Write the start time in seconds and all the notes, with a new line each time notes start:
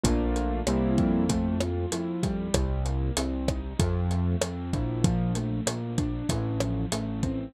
0.04 A#1 A3 A#3 D4 F4, kick, closed hi-hat
0.36 closed hi-hat
0.67 C2 G3 A#3 C4 E4, cross-stick, closed hi-hat
0.98 F2, kick, closed hi-hat
1.29 A3, kick, closed hi-hat
1.61 F4, cross-stick, closed hi-hat
1.92 F2 E4, closed hi-hat
2.23 G3, kick, closed hi-hat
2.54 C2, kick, cross-stick, closed hi-hat
2.85 A#3, closed hi-hat
3.17 C2 C4, closed hi-hat
3.48 D#4, kick, cross-stick, closed hi-hat
3.79 F2 F3, kick, closed hi-hat
4.11 A3, closed hi-hat
4.42 F2 C4, cross-stick, closed hi-hat
4.73 A#1 E4, kick, closed hi-hat
5.04 F3, kick, closed hi-hat
5.35 A3, closed hi-hat
5.66 A#1 A#3, cross-stick, closed hi-hat
5.98 D4, kick, closed hi-hat
6.29 A1 E3, kick, closed hi-hat
6.60 F3, cross-stick, closed hi-hat
6.92 A1 A3, closed hi-hat
7.23 C4, kick, closed hi-hat